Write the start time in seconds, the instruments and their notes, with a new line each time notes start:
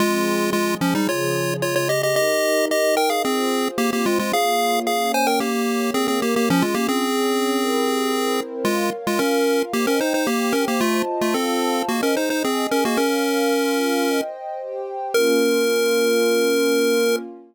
0.00 pad 2 (warm) F3 C4 G#4, lead 1 (square) G#3 F4
0.53 pad 2 (warm) F3 G#3 G#4, lead 1 (square) G#3 F4
0.81 lead 1 (square) F3 C#4
0.95 lead 1 (square) G3 D#4
1.08 pad 2 (warm) C#3 F3 G#4, lead 1 (square) F4 C#5
1.62 pad 2 (warm) C#3 G#3 G#4, lead 1 (square) F4 C#5
1.76 lead 1 (square) F4 C#5
1.89 lead 1 (square) G4 D#5
2.03 lead 1 (square) G4 D#5
2.16 pad 2 (warm) D#4 G4 A#4, lead 1 (square) G4 D#5
2.70 pad 2 (warm) D#4 A#4 D#5, lead 1 (square) G4 D#5
2.97 lead 1 (square) A#4 G5
3.10 lead 1 (square) G#4 F5
3.24 lead 1 (square) C4 G#4, pad 2 (warm) F4 G#4 C5
3.78 lead 1 (square) A#3 G4, pad 2 (warm) C4 F4 C5
3.93 lead 1 (square) A#3 G4
4.06 lead 1 (square) G#3 F4
4.19 lead 1 (square) G#3 F4
4.33 pad 2 (warm) A#3 F4 C#5, lead 1 (square) G#4 F5
4.87 pad 2 (warm) A#3 C#4 C#5, lead 1 (square) G#4 F5
5.14 lead 1 (square) C5 G#5
5.27 lead 1 (square) A#4 G5
5.40 lead 1 (square) A#3 G4, pad 2 (warm) A#3 G4 C#5
5.94 pad 2 (warm) A#3 A#4 C#5, lead 1 (square) C4 G#4
6.08 lead 1 (square) C4 G#4
6.22 lead 1 (square) A#3 G4
6.36 lead 1 (square) A#3 G4
6.49 lead 1 (square) F3 C#4, pad 2 (warm) C#4 F4 G#4
6.62 lead 1 (square) G#3 F4
6.74 lead 1 (square) A#3 G4
6.89 lead 1 (square) C4 G#4
7.03 pad 2 (warm) C#4 G#4 C#5
7.57 pad 2 (warm) C4 E4 G4 A#4
8.11 pad 2 (warm) C4 E4 A#4 C5
8.65 lead 1 (square) G#3 F4, pad 2 (warm) A#4 C#5 F5
9.07 lead 1 (square) G#3 F4
9.19 lead 1 (square) C#4 A#4, pad 2 (warm) F4 A#4 F5
9.73 lead 1 (square) A#3 G4, pad 2 (warm) C5 D#5 G5
9.87 lead 1 (square) C#4 A#4
10.01 lead 1 (square) D#4 C5
10.14 lead 1 (square) D#4 C5
10.27 lead 1 (square) A#3 G4, pad 2 (warm) G4 C5 G5
10.53 lead 1 (square) C#4 A#4
10.68 lead 1 (square) A#3 G4
10.81 lead 1 (square) A3 F4, pad 2 (warm) F4 C5 D#5 A5
11.21 lead 1 (square) A3 F4
11.34 lead 1 (square) C4 A4, pad 2 (warm) F4 C5 F5 A5
11.89 lead 1 (square) A#3 F#4, pad 2 (warm) G#4 C5 D#5
12.03 lead 1 (square) C#4 A#4
12.17 lead 1 (square) D#4 C5
12.30 lead 1 (square) D#4 C5
12.43 lead 1 (square) C4 G#4, pad 2 (warm) G#4 D#5 G#5
12.71 lead 1 (square) C#4 A#4
12.85 lead 1 (square) A#3 F#4
12.97 lead 1 (square) C#4 A#4, pad 2 (warm) A#4 C#5 F5
13.51 pad 2 (warm) F4 A#4 F5
14.06 pad 2 (warm) C5 D#5 G5
14.60 pad 2 (warm) G4 C5 G5
15.14 pad 2 (warm) A#3 C#4 F4, lead 1 (square) A#4